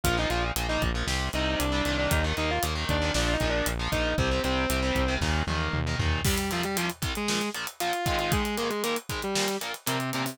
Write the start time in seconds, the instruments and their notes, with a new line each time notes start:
0.04 synth bass 1 A#1, overdriven guitar A#2 F3, distortion guitar F4 F5, kick, closed hi-hat
0.17 overdriven guitar A#2 F3, distortion guitar D#4 D#5
0.30 synth bass 1 A#1, overdriven guitar A#2 F3, distortion guitar F4 F5, closed hi-hat
0.56 synth bass 1 A#1, overdriven guitar A#2 F3, closed hi-hat
0.69 overdriven guitar A#2 F3, distortion guitar D#4 D#5
0.82 synth bass 1 A#1, kick, closed hi-hat
0.95 overdriven guitar A#2 F3
1.07 synth bass 1 C2, overdriven guitar C3 G3, snare
1.33 synth bass 1 C2, overdriven guitar C3 G3, distortion guitar D#4 D#5, closed hi-hat
1.59 synth bass 1 C2, distortion guitar D4 D5, closed hi-hat
1.72 overdriven guitar C3 G3, distortion guitar D4 D5
1.85 synth bass 1 C2, overdriven guitar A#2 D#3, closed hi-hat
1.98 distortion guitar D4 D5
2.11 synth bass 1 D#2, distortion guitar D#4 D#5, kick, closed hi-hat
2.24 overdriven guitar A#2 D#3
2.37 synth bass 1 D#2, overdriven guitar A#2 D#3, distortion guitar D#4 D#5, closed hi-hat
2.50 distortion guitar F4 F5
2.63 synth bass 1 D#2, overdriven guitar A#2 D#3, closed hi-hat
2.75 overdriven guitar A#2 D#3
2.89 synth bass 1 D#2, distortion guitar D4 D5, kick, closed hi-hat
3.02 overdriven guitar A#2 D#3
3.14 synth bass 1 A#1, overdriven guitar A#2 F3, distortion guitar D4 D5, snare
3.33 distortion guitar D#4 D#5
3.40 synth bass 1 A#1, overdriven guitar A#2 F3, kick, closed hi-hat
3.49 distortion guitar D4 D5
3.66 synth bass 1 A#1, closed hi-hat
3.79 overdriven guitar A#2 F3
3.92 synth bass 1 A#1, overdriven guitar A#2 F3, distortion guitar D#4 D#5, kick, closed hi-hat
4.18 synth bass 1 C2, overdriven guitar C3 G3, distortion guitar C4 C5, kick, closed hi-hat
4.31 overdriven guitar C3 G3
4.44 synth bass 1 C2, overdriven guitar C3 G3, distortion guitar C4 C5, closed hi-hat
4.70 synth bass 1 C2, overdriven guitar C3 G3, closed hi-hat
4.83 overdriven guitar C3 G3
4.95 synth bass 1 C2, kick, closed hi-hat
5.08 overdriven guitar C3 G3
5.21 synth bass 1 D#2, overdriven guitar A#2 D#3, kick, snare
5.47 synth bass 1 D#2, overdriven guitar A#2 D#3, high tom
5.73 synth bass 1 D#2, mid tom
5.87 overdriven guitar A#2 D#3
5.99 synth bass 1 D#2, overdriven guitar A#2 D#3, floor tom
6.24 overdriven guitar C2 C3 G3, distortion guitar G3 G4, kick, crash
6.38 closed hi-hat
6.51 overdriven guitar C2 C3 G3, distortion guitar F3 F4, closed hi-hat
6.63 distortion guitar G3 G4, closed hi-hat
6.76 overdriven guitar C2 C3 G3, distortion guitar F3 F4, closed hi-hat
6.90 closed hi-hat
7.02 overdriven guitar C2 C3 G3, kick, closed hi-hat
7.15 distortion guitar G#3 G#4, closed hi-hat
7.28 overdriven guitar A#1 A#2 F3, snare
7.41 closed hi-hat
7.55 overdriven guitar A#1 A#2 F3, closed hi-hat
7.67 closed hi-hat
7.80 overdriven guitar A#1 A#2 F3, distortion guitar F4 F5, closed hi-hat
7.93 closed hi-hat
8.06 overdriven guitar G#2 D#3 G#3, distortion guitar F4 F5, kick, closed hi-hat
8.19 distortion guitar F4 F5, closed hi-hat
8.32 distortion guitar G#3 G#4, kick, closed hi-hat
8.45 closed hi-hat
8.58 overdriven guitar G#2 D#3 G#3, distortion guitar A#3 A#4, closed hi-hat
8.70 distortion guitar G#3 G#4, closed hi-hat
8.83 overdriven guitar G#2 D#3 G#3, distortion guitar A#3 A#4, closed hi-hat
8.96 closed hi-hat
9.09 overdriven guitar G#2 D#3 G#3, kick, closed hi-hat
9.22 distortion guitar G3 G4, closed hi-hat
9.35 overdriven guitar A#2 F3 A#3, snare
9.48 closed hi-hat
9.61 overdriven guitar A#2 F3 A#3, closed hi-hat
9.74 closed hi-hat
9.86 overdriven guitar A#2 F3 A#3, distortion guitar C3 C4, closed hi-hat
10.00 closed hi-hat
10.13 overdriven guitar A#2 F3 A#3, distortion guitar C3 C4, closed hi-hat
10.25 distortion guitar C3 C4, open hi-hat